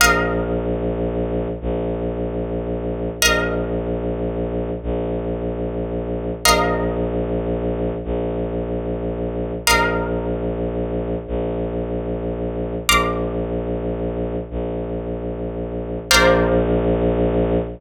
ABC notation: X:1
M:12/8
L:1/8
Q:3/8=149
K:Bbmix
V:1 name="Violin" clef=bass
B,,,12 | B,,,12 | B,,,12 | B,,,12 |
B,,,12 | B,,,12 | B,,,12 | B,,,12 |
B,,,12 | B,,,12 | B,,,12 |]
V:2 name="Pizzicato Strings"
[Bef]12- | [Bef]12 | [Bef]12- | [Bef]12 |
[Bef]12- | [Bef]12 | [Bef]12- | [Bef]12 |
[bc'd'f']12- | [bc'd'f']12 | [Bcdf]12 |]